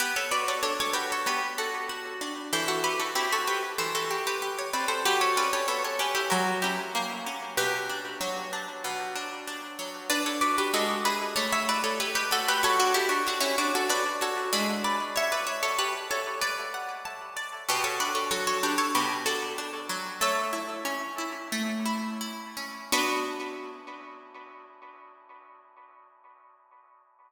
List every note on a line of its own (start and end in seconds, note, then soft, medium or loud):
0.00 1.26 B3 medium
0.00 0.14 G4 medium
0.00 0.14 B4 medium
0.16 0.31 A4 medium
0.16 0.31 C#5 medium
0.31 0.94 F#4 medium
0.31 0.46 B4 medium
0.31 0.46 D5 medium
0.48 0.62 A4 medium
0.48 0.62 C#5 medium
0.63 2.21 D4 medium
0.63 0.78 A4 medium
0.63 0.78 C#5 medium
0.80 0.95 A4 medium
0.80 0.95 C#5 medium
0.93 1.89 F#4 medium
0.93 1.08 G4 medium
0.93 1.08 B4 medium
1.12 1.27 A4 medium
1.12 1.27 C#5 medium
1.26 2.46 B3 medium
1.26 1.56 G4 medium
1.26 1.56 B4 medium
1.58 1.86 F#4 medium
1.58 1.86 A4 medium
1.89 2.49 F#4 medium
2.21 2.51 D4 medium
2.53 3.78 E3 medium
2.53 2.68 A4 medium
2.53 2.68 C5 medium
2.68 2.83 F#4 medium
2.68 2.83 A4 medium
2.84 2.99 G4 medium
2.84 2.99 B4 medium
3.00 3.15 F#4 medium
3.00 3.15 A4 medium
3.15 4.73 C4 medium
3.15 3.31 E4 medium
3.15 3.31 G4 medium
3.33 3.48 F#4 medium
3.33 3.48 A4 medium
3.48 3.73 G4 medium
3.48 3.73 B4 medium
3.78 4.99 E3 medium
3.78 3.93 A4 medium
3.78 3.93 C5 medium
3.95 4.24 F#4 medium
3.95 4.24 A4 medium
4.11 4.41 G4 medium
4.27 4.55 G4 medium
4.27 4.55 B4 medium
4.42 5.02 G4 medium
4.59 4.74 C#5 medium
4.73 5.04 C4 medium
4.73 4.88 B4 medium
4.73 4.88 D5 medium
4.88 5.03 A4 medium
4.88 5.03 C5 medium
5.05 6.25 F#3 medium
5.05 5.20 G4 medium
5.05 5.20 B4 medium
5.21 5.36 A4 medium
5.21 5.36 C#5 medium
5.37 5.99 C#4 medium
5.37 5.52 B4 medium
5.37 5.52 D5 medium
5.53 5.67 A4 medium
5.53 5.67 C#5 medium
5.68 6.28 B3 medium
5.68 5.83 A4 medium
5.68 5.83 C#5 medium
5.84 5.99 A4 medium
5.84 5.99 C#5 medium
5.99 6.30 C#4 medium
5.99 6.14 G4 medium
5.99 6.14 B4 medium
6.15 6.30 E4 medium
6.15 6.30 G4 medium
6.30 7.52 F#3 loud
6.30 6.61 F#4 medium
6.30 6.61 A#4 medium
6.62 7.26 C#4 medium
6.62 6.92 E4 medium
6.62 6.92 G4 medium
6.95 7.55 A#3 medium
7.26 7.56 C#4 medium
7.57 8.84 B2 medium
7.57 8.69 G4 medium
7.57 8.69 B4 medium
7.89 8.52 D4 medium
8.21 9.78 F#3 medium
8.53 9.15 D4 medium
8.84 10.04 B2 medium
9.16 9.47 D4 medium
9.47 10.07 D4 medium
9.79 10.09 F#3 medium
10.10 10.70 D4 loud
10.10 10.25 B4 medium
10.10 10.25 D5 loud
10.26 10.41 A4 medium
10.26 10.41 C#5 medium
10.41 10.72 F#4 medium
10.41 10.56 B4 medium
10.41 10.56 D5 medium
10.58 10.73 G4 medium
10.58 10.73 B4 medium
10.74 11.34 G#3 loud
10.74 11.03 F#4 medium
10.74 11.03 A4 medium
11.05 11.35 E4 medium
11.05 11.36 G#4 medium
11.05 11.36 B4 medium
11.36 12.31 A3 medium
11.36 11.51 A4 medium
11.36 11.51 C#5 medium
11.53 11.68 C#5 medium
11.53 11.68 E5 medium
11.69 12.59 E4 medium
11.69 11.84 B4 medium
11.69 11.84 D5 medium
11.84 11.99 A4 medium
11.84 11.99 C#5 medium
12.00 12.15 G4 medium
12.00 12.15 B4 medium
12.00 12.60 C#5 medium
12.15 12.30 G4 medium
12.15 12.30 B4 medium
12.31 12.61 A3 medium
12.31 12.47 F#4 medium
12.31 12.47 A4 medium
12.48 12.63 G4 medium
12.48 12.63 B4 loud
12.63 13.83 F#4 loud
12.63 12.79 A4 medium
12.63 12.79 C#5 medium
12.80 12.95 D4 medium
12.80 12.95 F#4 medium
12.94 13.09 E4 medium
12.94 13.09 G4 medium
12.94 13.84 A4 medium
13.09 13.24 D4 medium
13.09 13.24 F#4 medium
13.27 13.43 D4 medium
13.27 13.43 F#4 medium
13.27 13.87 C#5 medium
13.41 13.56 C#4 medium
13.41 13.56 E4 medium
13.58 13.73 D4 medium
13.58 13.73 F#4 medium
13.75 13.90 F#4 medium
13.75 13.90 A4 medium
13.89 14.49 D4 medium
13.89 14.20 B4 medium
13.89 14.20 D5 medium
14.21 14.51 F#4 medium
14.21 14.53 A4 medium
14.21 14.53 C#5 medium
14.53 15.09 G#3 medium
14.53 15.09 D4 medium
14.53 15.09 E4 loud
14.53 15.09 B4 medium
14.84 15.15 B4 medium
14.84 15.15 D5 medium
15.16 16.36 C#5 medium
15.16 15.32 C#5 medium
15.16 15.32 E5 medium
15.32 15.47 B4 medium
15.32 15.47 D5 medium
15.47 15.62 C#5 medium
15.47 15.62 E5 medium
15.63 15.78 A4 medium
15.63 15.78 C#5 medium
15.78 16.07 G4 medium
15.78 16.07 B4 medium
15.78 16.38 A5 medium
16.11 16.41 A4 medium
16.11 16.41 C#5 medium
16.41 16.95 B4 medium
16.41 16.95 D5 medium
16.41 17.36 D5 medium
16.74 17.64 F#5 medium
17.05 17.65 A5 medium
17.37 17.67 D5 medium
17.69 18.94 B2 loud
17.69 17.85 G4 medium
17.69 17.85 B4 medium
17.84 17.99 A4 medium
17.84 17.99 C#5 medium
18.00 18.63 D4 medium
18.00 18.15 B4 medium
18.00 18.15 D5 medium
18.15 18.30 A4 medium
18.15 18.30 C#5 medium
18.31 19.89 F#3 medium
18.31 18.46 A4 medium
18.31 18.46 C#5 medium
18.47 18.62 A4 medium
18.47 18.62 C#5 medium
18.63 19.26 D4 medium
18.63 18.78 G4 medium
18.63 18.78 B4 medium
18.78 18.93 A4 medium
18.78 18.93 C#5 medium
18.95 20.15 B2 medium
18.95 19.23 G4 medium
18.95 19.23 B4 medium
19.26 19.58 D4 medium
19.26 19.54 F#4 medium
19.26 19.54 A4 medium
19.58 20.18 D4 medium
19.89 20.19 F#3 medium
20.21 21.52 A3 loud
20.21 21.47 C#5 medium
20.21 21.47 E5 medium
20.53 21.18 E4 medium
20.85 22.56 C#4 medium
21.18 21.85 E4 medium
21.52 22.86 A3 medium
21.86 22.20 E4 medium
22.21 22.89 E4 medium
22.57 22.91 C#4 medium
22.92 25.95 B3 loud
22.92 25.95 D4 loud
22.92 25.95 F#4 loud
22.92 25.96 B4 loud